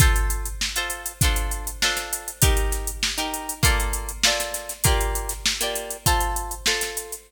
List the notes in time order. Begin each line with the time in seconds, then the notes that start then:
0.00 F4 A4 C5, kick, closed hi-hat
0.16 closed hi-hat
0.30 closed hi-hat
0.45 closed hi-hat
0.61 snare
0.76 F4 A4 C5, closed hi-hat
0.90 closed hi-hat
1.06 closed hi-hat
1.21 D4 F4 A4 C5, kick, closed hi-hat
1.36 closed hi-hat
1.51 closed hi-hat
1.67 closed hi-hat
1.82 D4 F4 A4 C5, snare
1.97 snare, closed hi-hat
2.13 closed hi-hat
2.28 closed hi-hat
2.42 D#4 G4 A#4, kick, closed hi-hat
2.57 closed hi-hat
2.72 snare, closed hi-hat
2.87 closed hi-hat
3.03 snare
3.18 D#4 G4 A#4, snare, closed hi-hat
3.34 closed hi-hat
3.49 closed hi-hat
3.63 A#3 F4 A4 D5, kick, closed hi-hat
3.80 closed hi-hat
3.93 closed hi-hat
4.09 closed hi-hat
4.23 A#3 F4 A4 D5, snare
4.40 snare, closed hi-hat
4.54 snare, closed hi-hat
4.69 snare, closed hi-hat
4.84 A#3 F4 G4 D5, kick, closed hi-hat
5.01 closed hi-hat
5.15 closed hi-hat
5.29 snare, closed hi-hat
5.46 snare
5.61 A#3 F4 G4 D5, closed hi-hat
5.76 closed hi-hat
5.91 closed hi-hat
6.06 F4 A4 C5, kick, closed hi-hat
6.20 closed hi-hat
6.36 closed hi-hat
6.51 closed hi-hat
6.66 F4 A4 C5, snare
6.81 snare, closed hi-hat
6.97 closed hi-hat
7.12 closed hi-hat